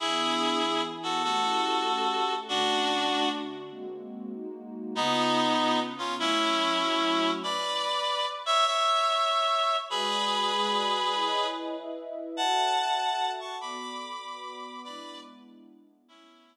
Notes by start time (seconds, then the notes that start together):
0.00 E3 B3 D4 E4 G#4
0.62 E3 B3 E4 G#4
1.03 F#4 A4
1.23 A3 C#4 E4 F#4 G4 A4
1.86 A3 C#4 G4 A4
2.48 D3 A3 C#4 D4 F#4
3.09 D3 A3 D4 F#4
3.71 G#3 A#3 C4 F#4
4.33 G#3 A#3 D#4 F#4
4.94 C#3 B3 D#4 F4
5.57 C#3 B3 C#4 F4
5.98 C#4 F4
6.18 F#3 A3 C#4 E4
6.80 F#3 A3 E4 F#4
7.43 B4 D5
8.46 C#5 E5
8.66 C#5 E5
9.90 G#3 F#4 G#4 B4 D5
10.51 G#3 F#4 G#4 D5
11.14 E4 B4 C#5 D#5
11.76 E4 B4 D#5 E5
12.37 F#4 A4 C#5 E5 F#5 A5
12.99 F#4 A4 E5 F#5
13.40 A5 C#6
13.61 B3 F#4 A4 D5 B5 D6
14.23 B3 F#4 B4 D5
14.84 G#3 B3 D4 E4 B4 D5
16.08 A3 B3 C#4 E4